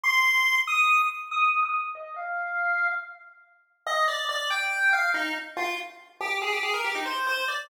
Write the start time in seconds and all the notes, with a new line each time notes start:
0.03 C6
0.67 D#6
1.31 D#6
1.63 D#6
1.74 D#6
1.95 D#5
2.16 F5
3.86 D#5
4.08 D5
4.29 D5
4.50 G5
4.93 F5
5.14 D#4
5.57 F4
6.20 G4
6.42 G#4
6.52 G4
6.63 G#4
6.74 A#4
6.84 G4
6.95 D#4
7.06 C5
7.27 C5
7.48 D5